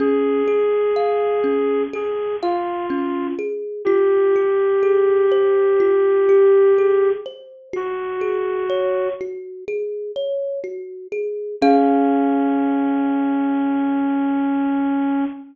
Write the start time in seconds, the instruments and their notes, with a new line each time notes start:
0.00 kalimba C#4, ocarina G#4
0.48 kalimba G#4
0.96 kalimba F5
1.44 kalimba C#4
1.93 kalimba G#4, ocarina G#4
2.43 ocarina F4, kalimba F5
2.90 kalimba C#4
3.39 kalimba G#4
3.85 kalimba F4, ocarina G4
4.36 kalimba G4
4.83 kalimba G#4
5.32 kalimba C5
5.80 kalimba F4
6.29 kalimba G4
6.78 kalimba G#4
7.26 kalimba C5
7.73 kalimba F#4, ocarina F#4
8.21 kalimba G#4
8.70 kalimba C#5
9.21 kalimba F#4
9.68 kalimba G#4
10.16 kalimba C#5
10.64 kalimba F#4
11.12 kalimba G#4
11.61 ocarina C#4, kalimba C#4 G#4 F5